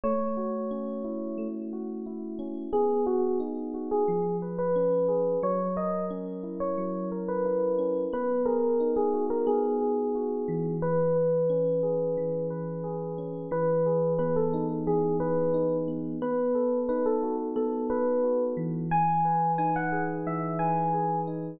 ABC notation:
X:1
M:4/4
L:1/16
Q:1/4=89
K:E
V:1 name="Electric Piano 1"
c10 z6 | [K:B] G2 F2 z3 G3 z B5 | c2 d2 z3 c3 z B5 | B2 A3 G2 A G8 |
B10 z6 | [K:E] B4 B A2 z G2 B4 z2 | B4 B A2 z A2 B4 z2 | g4 g f2 z e2 g4 z2 |]
V:2 name="Electric Piano 1"
A,2 F2 C2 E2 A,2 F2 E2 C2 | [K:B] B,2 G2 D2 F2 ^E,2 B2 C2 G2 | F,2 A2 C2 E2 F,2 A2 E2 C2 | B,2 G2 D2 F2 B,2 G2 F2 E,2- |
E,2 B2 C2 G2 E,2 B2 G2 C2 | [K:E] E,2 G2 B,2 D2 E,2 G2 D2 B,2 | B,2 A2 D2 F2 B,2 A2 F2 E,2- | E,2 B2 D2 G2 E,2 B2 G2 D2 |]